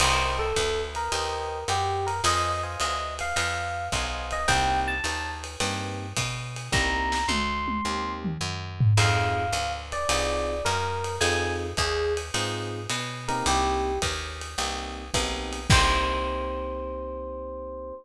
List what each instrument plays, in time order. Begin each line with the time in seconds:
0.00 electric bass (finger) C2, electric piano 1 A#4 C5 D#5 G5, crash, ride
0.39 electric piano 1 A4
0.56 electric bass (finger) D2, kick, hi-hat pedal, ride
0.95 electric piano 1 A#4, ride
1.12 electric bass (finger) D#2, electric piano 1 A#4 C5 D#5 G5, ride
1.68 electric bass (finger) F#2, electric piano 1 G4, hi-hat pedal, ride
2.07 electric piano 1 A#4, ride
2.24 electric bass (finger) F2, electric piano 1 C5 D#5 F5 G#5, ride
2.63 electric piano 1 C5 D#5 F5 G#5
2.80 electric bass (finger) D2, electric piano 1 D#5, hi-hat pedal, ride
3.19 electric piano 1 F5, ride
3.36 electric bass (finger) F2, electric piano 1 F5, ride
3.92 electric bass (finger) B1, electric piano 1 C5 D#5 F5 G#5, kick, hi-hat pedal, ride
4.31 electric piano 1 D#5, ride
4.48 electric bass (finger) C2, electric piano 1 A#3 C4 D#4 G4 G5, kick, ride
4.88 electric piano 1 A5
5.04 electric bass (finger) D#2, hi-hat pedal, ride
5.44 ride
5.60 electric bass (finger) G2, electric piano 1 A#3 C4 D#4 G4, ride
6.17 electric bass (finger) B2, kick, hi-hat pedal, ride
6.56 ride
6.72 electric bass (finger) C2, electric piano 1 A#3 C4 D#4 G4 A#5, kick, snare
7.12 snare
7.28 electric bass (finger) D2, electric piano 1 C6, high tom
7.68 high tom
7.85 electric bass (finger) D#2, electric piano 1 A#3 C4 D#4 G4
8.25 mid tom
8.41 electric bass (finger) F#2
8.80 floor tom
8.97 electric bass (finger) F2, electric piano 1 C4 D#4 F4 G#4 F5, crash, ride
9.53 electric bass (finger) D2, hi-hat pedal, ride
9.92 electric piano 1 D5, ride
10.09 electric bass (finger) C2, electric piano 1 C4 D#4 F4 G#4, ride
10.65 electric bass (finger) F#2, electric piano 1 A#4, hi-hat pedal, ride
11.04 ride
11.21 electric bass (finger) F2, electric piano 1 C4 D#4 F4 G#4 G#5, ride
11.77 electric bass (finger) D#2, electric piano 1 G#4, kick, hi-hat pedal, ride
12.17 ride
12.34 electric bass (finger) G#2, electric piano 1 C4 D#4 F4 G#4, ride
12.89 electric bass (finger) B2, hi-hat pedal, ride
13.28 electric piano 1 A#3 C4 D#4 G4 A#4, ride
13.46 electric bass (finger) C2, electric piano 1 G4, ride
14.02 electric bass (finger) D#2, kick, hi-hat pedal, ride
14.41 ride
14.58 electric bass (finger) C2, electric piano 1 A#3 C4 D#4 G4, ride
15.14 electric bass (finger) B1, electric piano 1 A#3 C4 D#4 G4, kick, hi-hat pedal, ride
15.53 ride
15.70 electric bass (finger) C2, electric piano 1 A#3 C4 D#4 G4 C5, kick, crash